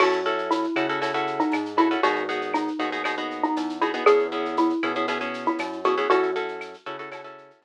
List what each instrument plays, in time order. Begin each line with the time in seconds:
0.00 synth bass 1 F#2, acoustic guitar (steel) C#4 E4 F#4 A4, xylophone F#4, crash, cowbell, claves
0.12 shaker
0.26 acoustic guitar (steel) C#4 E4 F#4 A4, shaker
0.38 shaker
0.51 xylophone E4, tambourine, shaker
0.64 shaker
0.76 synth bass 1 C#3, acoustic guitar (steel) C#4 E4 F#4 A4, claves, shaker
0.89 acoustic guitar (steel) C#4 E4 F#4 A4, shaker
1.01 acoustic guitar (steel) C#4 E4 F#4 A4, cowbell, shaker
1.14 acoustic guitar (steel) C#4 E4 F#4 A4, shaker
1.27 shaker
1.40 xylophone D#4, shaker
1.52 synth bass 1 G#2, tambourine, cowbell, claves, shaker
1.66 shaker
1.77 acoustic guitar (steel) C#4 E4 F#4 A4, xylophone E4, cowbell, shaker
1.91 acoustic guitar (steel) C#4 E4 F#4 A4, shaker
2.03 synth bass 1 G#1, acoustic guitar (steel) B3 D#4 F#4 G#4, xylophone F#4, cowbell, shaker
2.16 shaker
2.29 acoustic guitar (steel) B3 D#4 F#4 G#4, shaker
2.41 shaker
2.54 xylophone D#4, tambourine, claves, shaker
2.67 shaker
2.79 synth bass 1 D#2, acoustic guitar (steel) B3 D#4 F#4 G#4, shaker
2.92 acoustic guitar (steel) B3 D#4 F#4 G#4, shaker
3.04 acoustic guitar (steel) B3 D#4 F#4 G#4, cowbell, claves, shaker
3.18 acoustic guitar (steel) B3 D#4 F#4 G#4, shaker
3.31 shaker
3.43 xylophone D#4, shaker
3.56 synth bass 1 E2, tambourine, cowbell, shaker
3.69 shaker
3.81 acoustic guitar (steel) B3 D#4 F#4 G#4, xylophone E4, cowbell, shaker
3.94 acoustic guitar (steel) B3 D#4 F#4 G#4, shaker
4.06 synth bass 1 E2, acoustic guitar (steel) B3 C#4 E4 G#4, xylophone G#4, cowbell, claves, shaker
4.19 shaker
4.31 acoustic guitar (steel) B3 C#4 E4 G#4, shaker
4.45 shaker
4.57 xylophone E4, tambourine, shaker
4.70 shaker
4.83 synth bass 1 B2, acoustic guitar (steel) B3 C#4 E4 G#4, claves, shaker
4.95 acoustic guitar (steel) B3 C#4 E4 G#4, shaker
5.08 acoustic guitar (steel) B3 C#4 E4 G#4, cowbell, shaker
5.21 acoustic guitar (steel) B3 C#4 E4 G#4, shaker
5.34 shaker
5.46 xylophone E4, shaker
5.59 synth bass 1 F#2, tambourine, cowbell, claves, shaker
5.73 shaker
5.84 acoustic guitar (steel) B3 C#4 E4 G#4, xylophone F#4, cowbell, shaker
5.98 acoustic guitar (steel) B3 C#4 E4 G#4, shaker
6.10 synth bass 1 F#2, acoustic guitar (steel) C#4 E4 F#4 A4, xylophone F#4, cowbell, shaker
6.23 shaker
6.35 acoustic guitar (steel) C#4 E4 F#4 A4, shaker
6.48 shaker
6.61 tambourine, claves, shaker
6.74 shaker
6.86 synth bass 1 C#3, acoustic guitar (steel) C#4 E4 F#4 A4, shaker
6.99 acoustic guitar (steel) C#4 E4 F#4 A4, shaker
7.12 acoustic guitar (steel) C#4 E4 F#4 A4, cowbell, claves, shaker
7.24 acoustic guitar (steel) C#4 E4 F#4 A4, shaker
7.38 shaker
7.50 shaker
7.62 synth bass 1 F#2, tambourine, cowbell, shaker